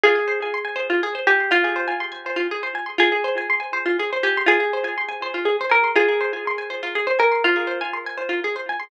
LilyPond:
<<
  \new Staff \with { instrumentName = "Orchestral Harp" } { \time 6/8 \key f \minor \tempo 4. = 81 aes'2~ aes'8 g'8 | f'4 r2 | aes'2~ aes'8 g'8 | aes'2~ aes'8 bes'8 |
aes'2~ aes'8 bes'8 | f'4 r2 | }
  \new Staff \with { instrumentName = "Orchestral Harp" } { \time 6/8 \key f \minor f'16 aes'16 c''16 aes''16 c'''16 aes''16 c''16 f'16 aes'16 c''16 aes''16 c'''16 | r16 aes'16 c''16 aes''16 c'''16 aes''16 c''16 f'16 aes'16 c''16 aes''16 c'''16 | f'16 aes'16 c''16 aes''16 c'''16 aes''16 c''16 f'16 aes'16 c''16 aes''16 c'''16 | f'16 aes'16 c''16 aes''16 c'''16 aes''16 c''16 f'16 aes'16 c''16 aes''16 c'''16 |
f'16 aes'16 c''16 aes''16 c'''16 aes''16 c''16 f'16 aes'16 c''16 aes''16 c'''16 | r16 aes'16 c''16 aes''16 c'''16 aes''16 c''16 f'16 aes'16 c''16 aes''16 c'''16 | }
>>